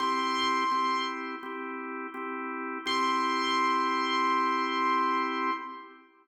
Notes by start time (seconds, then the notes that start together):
0.00 C4 E4 G4 C6
0.71 C4 E4 G4
1.43 C4 E4 G4
2.14 C4 E4 G4
2.86 C4 E4 G4 C6